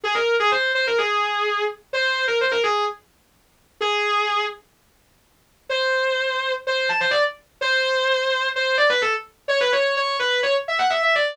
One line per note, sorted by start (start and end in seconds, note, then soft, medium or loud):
0.04 0.15 G#4 medium
0.15 0.35 A#4 medium
0.40 0.51 G#4 medium
0.52 0.72 C5 medium
0.75 0.86 C5 medium
0.87 0.98 A#4 medium
0.98 1.65 G#4 medium
1.93 2.25 C5 medium
2.27 2.39 A#4 medium
2.41 2.52 C5 medium
2.51 2.63 A#4 medium
2.63 2.84 G#4 medium
3.81 4.44 G#4 medium
5.69 6.52 C5 medium
6.67 6.89 C5 medium
6.89 7.00 A5 medium
7.00 7.12 C5 medium
7.11 7.22 D5 medium
7.61 8.47 C5 loud
8.56 8.76 C5 medium
8.78 8.89 D5 medium
8.89 9.01 B4 medium
9.02 9.13 A4 medium
9.48 9.59 C#5 medium
9.61 9.72 B4 medium
9.72 9.95 C#5 medium
9.97 10.17 C#5 medium
10.19 10.41 B4 medium
10.43 10.54 C#5 medium
10.68 10.79 E5 medium
10.79 10.90 F#5 medium
10.90 11.01 E5 medium
11.03 11.14 E5 medium
11.15 11.37 D5 medium